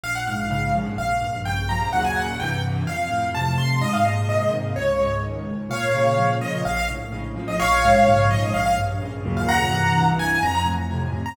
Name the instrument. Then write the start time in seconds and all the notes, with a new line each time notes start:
acoustic grand piano
0.04 A#1 F5
0.15 F#5
0.27 G#2 F5
0.50 C#3 F5
0.75 F3
0.98 A#1 F5
1.21 G2
1.45 C#3 G5
1.69 F3 A#5
1.93 D#2 F#2 A#2 C#3 F#5
2.05 G#5
2.16 F#5
2.40 C2 G2 E3 G5
2.86 F2 F5
3.10 A2
3.35 C3 A5
3.58 F2 C6
3.81 G#2 D#5
3.93 F5
4.05 A#2 D#5
4.28 C3 D#5
4.51 D#3
4.76 C#2 C#5
5.00 G#2
5.22 D#3
5.49 C#2
5.69 A#2 C#5 F5
5.95 C#3
6.18 F3
6.41 A#2 D#5
6.65 A#1 F5
6.77 F5
6.90 A2
7.12 C#3
7.36 F3
7.48 D#5
7.60 A#1 C#5 F5
7.84 G#2
8.06 C#3
8.31 F3 D#5
8.54 A#1 F5
8.66 F5
8.76 G2
9.02 C#3
9.25 D#2 F#2 A#2 C#3
9.37 F5
9.49 F#5 A#5
9.70 C2 G2 E3
10.19 G#5
10.43 F2 A#5
10.55 A#5
10.65 A2
10.91 C3
11.13 F2
11.26 A#5